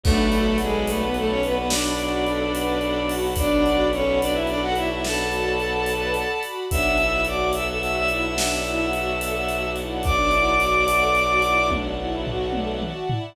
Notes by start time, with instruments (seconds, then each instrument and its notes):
0.03 violin B1 A3 A4, string ensemble 1 D4 D5 F#5 A5 B5, kick, crash
0.32 string ensemble 1 F#4, closed hi-hat
0.58 violin G#3 G#4, string ensemble 1 A4, closed hi-hat
0.87 violin A3 A4, string ensemble 1 B4, closed hi-hat
1.01 violin B3 B4
1.14 violin A3 A4, string ensemble 1 A4, closed hi-hat
1.29 violin C#4 C#5
1.43 violin B3 B4, string ensemble 1 F#4, closed hi-hat
1.55 violin B3 B4
1.69 violin D4 D5, string ensemble 1 D4, snare
1.99 string ensemble 1 F#4, closed hi-hat
2.26 string ensemble 1 A4, closed hi-hat
2.54 string ensemble 1 B4, closed hi-hat
2.81 string ensemble 1 A4, closed hi-hat
3.09 string ensemble 1 F#4, open hi-hat
3.36 string ensemble 1 D4, violin D4 D5, kick, closed hi-hat
3.66 string ensemble 1 F#4, closed hi-hat
3.92 violin C#4 C#5, string ensemble 1 A4, closed hi-hat
4.21 violin D4 D5, string ensemble 1 B4, closed hi-hat
4.33 violin E4 E5
4.47 violin D4 D5, string ensemble 1 A4, closed hi-hat
4.61 violin F#4 F#5
4.76 violin E4 E5, string ensemble 1 F#4, closed hi-hat
4.91 violin E4 E5
5.03 string ensemble 1 D4, violin A4 A5, snare
5.31 string ensemble 1 F#4, closed hi-hat
5.59 string ensemble 1 A4, closed hi-hat
5.86 string ensemble 1 B4, closed hi-hat
6.14 string ensemble 1 A4, closed hi-hat
6.43 string ensemble 1 F#4, closed hi-hat
6.70 violin B1 E5 E6, string ensemble 1 D4 D5 E5 F#5 A5, kick, closed hi-hat
6.98 string ensemble 1 E4, closed hi-hat
7.25 string ensemble 1 F#4, violin D5 D6, closed hi-hat
7.53 string ensemble 1 A4, violin E5 E6, closed hi-hat
7.67 violin E5 E6
7.81 string ensemble 1 F#4, violin E5 E6, closed hi-hat
7.96 violin E5 E6
8.08 string ensemble 1 E4, violin E5 E6, closed hi-hat
8.24 violin E5 E6
8.37 string ensemble 1 D4, violin E5 E6, snare
8.64 string ensemble 1 E4, closed hi-hat
8.93 string ensemble 1 F#4, closed hi-hat
9.20 string ensemble 1 A4, closed hi-hat
9.48 string ensemble 1 F#4, closed hi-hat
9.76 string ensemble 1 E4, closed hi-hat
10.03 string ensemble 1 D4, violin D5 D6, kick, closed hi-hat
10.31 string ensemble 1 E4, closed hi-hat
10.60 string ensemble 1 F#4, closed hi-hat
10.88 string ensemble 1 A4, closed hi-hat
11.15 string ensemble 1 F#4, closed hi-hat
11.42 string ensemble 1 E4, closed hi-hat
11.70 string ensemble 1 D4, kick, high tom
11.99 string ensemble 1 E4
12.27 string ensemble 1 F#4, floor tom
12.53 string ensemble 1 A4, high tom
12.81 string ensemble 1 F#4, mid tom
13.10 string ensemble 1 E4, floor tom